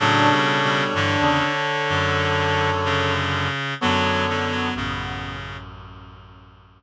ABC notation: X:1
M:4/4
L:1/16
Q:1/4=63
K:Bm
V:1 name="Clarinet"
[Ac]16 | [Ac]4 z12 |]
V:2 name="Clarinet"
D8 z8 | B,8 z8 |]
V:3 name="Clarinet" clef=bass
C,4 D,8 C,4 | F,2 D, F, C,4 z8 |]
V:4 name="Clarinet" clef=bass
(3[A,,F,]2 [B,,G,]2 [B,,G,]2 [G,,E,] [E,,C,] z2 [F,,D,]8 | [F,,D,]4 [A,,,F,,]10 z2 |]